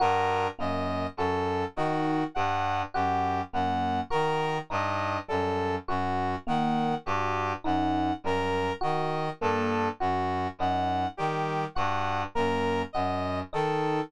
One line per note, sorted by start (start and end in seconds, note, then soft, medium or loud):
0.00 0.47 G2 medium
0.00 0.47 F#4 medium
0.00 0.48 A#4 medium
0.59 1.06 F#2 medium
0.59 1.06 A#3 medium
0.59 1.07 D#5 medium
1.17 1.64 F#2 medium
1.17 1.65 F#4 medium
1.17 1.65 A4 medium
1.76 2.24 D#3 medium
1.76 2.24 D#4 medium
1.76 2.24 F#4 medium
2.35 2.83 G2 medium
2.35 2.83 G3 medium
2.35 2.82 F#5 medium
2.94 3.41 F#2 medium
2.94 3.41 F#4 medium
2.94 3.41 G4 medium
3.53 4.00 F#2 medium
3.53 4.00 A#3 medium
3.53 4.01 F#5 medium
4.10 4.59 D#3 medium
4.10 4.57 F#4 medium
4.10 4.58 A#4 medium
4.70 5.17 G2 medium
4.70 5.17 D#4 medium
4.70 5.19 D#5 medium
5.28 5.77 F#2 medium
5.28 5.75 G3 medium
5.28 5.75 A4 medium
5.88 6.35 F#2 medium
5.88 6.35 F#4 medium
5.88 6.36 F#4 medium
6.47 6.94 D#3 medium
6.47 6.94 A#3 medium
6.47 6.95 F#5 medium
7.06 7.53 G2 medium
7.06 7.54 F#4 medium
7.06 7.53 G4 medium
7.64 8.12 F#2 medium
7.64 8.11 D#4 medium
7.64 8.13 F#5 medium
8.24 8.71 F#2 medium
8.24 8.71 G3 medium
8.24 8.73 A#4 medium
8.81 9.29 D#3 medium
8.81 9.28 F#4 medium
8.81 9.30 D#5 medium
9.41 9.88 G2 medium
9.41 9.88 A#3 medium
9.41 9.88 A4 medium
10.00 10.47 F#2 medium
10.00 10.47 F#4 medium
10.00 10.48 F#4 medium
10.59 11.06 F#2 medium
10.59 11.07 D#4 medium
10.59 11.07 F#5 medium
11.17 11.65 D#3 medium
11.17 11.65 G3 medium
11.17 11.64 G4 medium
11.75 12.24 G2 medium
11.75 12.24 F#4 medium
11.75 12.22 F#5 medium
12.35 12.83 F#2 medium
12.35 12.82 A#3 medium
12.35 12.82 A#4 medium
12.93 13.41 F#2 medium
12.93 13.42 F#4 medium
12.93 13.40 D#5 medium
13.53 14.00 D#3 medium
13.53 14.00 D#4 medium
13.53 14.01 A4 medium